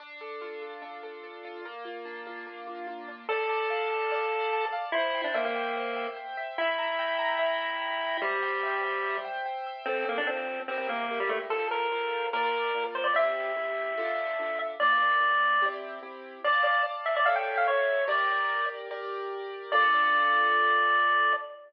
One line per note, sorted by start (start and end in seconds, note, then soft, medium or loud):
0.00 0.81 D4 loud
0.21 0.61 A4 medium
0.41 1.44 F4 medium
0.62 1.03 A4 medium
0.82 1.60 D4 medium
1.03 1.23 A4 medium
1.23 1.63 A4 medium
1.45 1.64 F4 medium
1.65 2.46 A#3 loud
1.85 2.26 F4 medium
2.05 3.08 D4 medium
2.27 2.67 F4 medium
2.47 3.25 A#3 medium
2.67 2.87 F4 medium
2.87 3.26 F4 medium
3.08 3.28 D4 medium
3.29 4.65 A4 medium
3.29 4.11 D5 loud
3.49 3.90 A5 medium
3.70 4.72 F5 medium
3.90 4.31 A5 medium
4.11 4.90 D5 loud
4.32 4.52 A5 medium
4.53 4.92 A5 medium
4.72 4.92 F5 medium
4.92 5.22 E4 medium
4.92 5.76 C5 loud
5.14 5.55 G5 medium
5.24 5.34 D4 medium
5.34 5.44 A#3 medium
5.34 6.37 E5 medium
5.45 6.07 A#3 medium
5.55 5.96 G5 medium
5.76 6.54 C5 medium
5.96 6.16 G5 medium
6.16 6.55 G5 medium
6.37 6.57 E5 loud
6.58 8.17 E4 medium
6.58 7.38 E5 loud
6.78 7.18 A#5 medium
6.99 8.01 G5 medium
7.18 7.59 A#5 medium
7.39 8.17 E5 loud
7.60 7.81 A#5 medium
7.81 8.20 A#5 medium
8.01 8.21 G5 medium
8.21 9.17 G3 medium
8.21 9.04 C5 loud
8.43 8.83 G5 medium
8.63 9.66 E5 medium
8.84 9.24 G5 medium
9.05 9.83 C5 medium
9.25 9.45 G5 medium
9.46 9.85 G5 medium
9.66 9.86 E5 medium
9.85 10.23 F3 medium
9.85 10.05 C4 loud
9.85 10.23 C4 medium
9.85 10.23 A4 medium
10.09 10.18 A#3 medium
10.18 10.27 D4 medium
10.27 10.64 F3 medium
10.27 10.60 C4 medium
10.27 10.64 C4 medium
10.27 10.64 A4 medium
10.68 10.77 C4 medium
10.68 11.06 E4 medium
10.68 11.06 G4 medium
10.68 11.06 A#4 medium
10.78 10.88 C4 medium
10.89 11.19 A#3 medium
11.10 11.47 E4 medium
11.10 11.47 G4 medium
11.10 11.47 A#4 medium
11.20 11.30 G3 medium
11.29 11.39 A3 medium
11.50 11.87 F4 medium
11.50 11.87 A4 medium
11.50 11.68 A4 medium
11.50 11.87 C5 medium
11.71 12.27 A#4 medium
11.92 12.29 F4 medium
11.92 12.29 A4 medium
11.92 12.29 C5 medium
12.33 12.70 A#3 medium
12.33 12.70 F4 medium
12.33 12.84 A#4 medium
12.33 12.70 D5 medium
12.75 13.12 A#3 medium
12.75 13.12 F4 medium
12.75 13.12 D5 medium
12.95 13.05 C5 medium
13.04 13.14 D5 medium
13.14 13.51 C4 medium
13.14 13.51 E4 medium
13.14 13.51 G4 medium
13.14 14.59 E5 loud
13.56 13.93 C4 medium
13.56 13.93 E4 medium
13.56 13.93 G4 medium
13.97 14.34 D4 medium
13.97 14.34 F4 medium
13.97 14.34 A4 medium
14.39 14.76 D4 medium
14.39 14.76 F4 medium
14.39 14.76 A4 medium
14.80 15.17 A#3 medium
14.80 15.17 D4 medium
14.80 15.17 F4 medium
14.80 15.66 D5 medium
15.20 15.57 A#3 medium
15.20 15.57 D4 medium
15.20 15.57 F4 medium
15.62 15.99 C4 medium
15.62 15.99 E4 medium
15.62 15.99 G4 medium
16.03 16.40 C4 medium
16.03 16.40 E4 medium
16.03 16.40 G4 medium
16.44 16.63 D5 medium
16.44 17.25 D5 loud
16.44 17.25 F5 medium
16.44 17.25 A5 medium
16.64 16.83 D5 medium
17.06 17.15 E5 medium
17.16 17.26 D5 medium
17.25 18.07 A4 medium
17.25 18.07 C#5 medium
17.25 18.07 E5 medium
17.25 17.35 F5 medium
17.36 17.56 G5 medium
17.57 17.67 F5 medium
17.67 18.05 C#5 medium
18.08 18.88 G4 loud
18.08 18.88 A#4 medium
18.08 18.88 D5 medium
18.08 18.66 D5 medium
18.91 19.71 G4 medium
18.91 19.71 A#4 medium
18.91 19.71 D5 medium
19.72 21.33 D4 loud
19.72 21.33 F4 loud
19.72 21.33 A4 loud
19.72 21.33 D5 loud